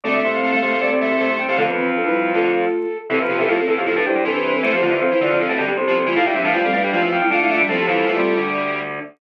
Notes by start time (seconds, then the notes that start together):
0.04 D2 D3 A3 C4 A4 D5
0.14 A3 E5
0.24 C2 C3 A3
0.33 F5
0.43 A3
0.52 A3 F5
0.62 C2 C3 A3 F5
0.72 A3
0.81 C2 C3 A3 D5
0.92 C2 C3
1.00 A3 E5
1.10 C2 C3
1.19 C2 C3 A3
1.29 C2 C3
1.38 C2 C3 G5
1.48 C2 C3 A3 F5
1.57 F2 C3 D3 F3 A3 A4
1.67 D3 B3 B4
1.77 E3 C4
1.96 F3 D4 A4
2.05 G3 E4 B4
2.34 D3 A3 F4 A4
3.10 E2 C3 E3 C4 A4
3.20 F2 F3 B4
3.29 F2 C3 F3 B3 G4
3.38 E2 C3 E3 A4
3.48 F2 A2 F3 A3 F4 A4
3.58 C4 A4
3.67 E2 E3 C4 A4
3.77 F2 F3 B3 G4
3.86 F2 A2 F3 A4
3.96 A2 A3 D4 B4
4.06 G2 G3 E4 G4 C5
4.15 G2 G3
4.24 C2 C3 E3 D4 A4 B4
4.34 D4 A4 B4
4.44 B4
4.54 C4 A4 B4
4.63 E2 E3 A3 C4 A4 C5
4.73 F2 F3 B3 G4
4.82 F2 D3 F3 A3 F4
4.91 E2 E3
5.01 F2 F3 C4 A4
5.11 E3 E4 C5
5.20 E2 D3 E3 F4 D5
5.30 F2 F3
5.39 F2 C3 F3 C4 A4
5.49 A2 B2 A3
5.58 G2 D3 G3
5.68 G2 G3 B3 G4
5.77 C2 C3 C4 A4
5.87 F3 B3 G4
5.96 C4 A4
6.06 E3 A3 F4
6.16 A2 A3 F4 F5
6.25 G2 A2 G3 E4 E5
6.35 G2 C3 F3 G3 D4
6.44 A2 E3 A3 F5
6.53 G2 F3 G3 A3 F4 F5
6.64 G3 C4 A4 F5
6.73 A2 G3 A3 D4 B4 F5
6.84 G2 G3
6.92 G2 F3 G3 A3 F4 F5
7.02 E2 E3
7.12 F2 F3 G5
7.21 F2 F3 G3 E4
7.30 D3 A3 D4 F4 F5
7.40 G3 E4 F5
7.50 A3 F4 E5
7.59 F3 G3 D4 E5
7.68 A2 F3 A3 C4 A4
7.79 B3 G4
7.87 F2 E3 F3 G3 E4
8.07 E2 E3 F3 A3 F4
8.16 C2 C3 G3
8.37 D2 D3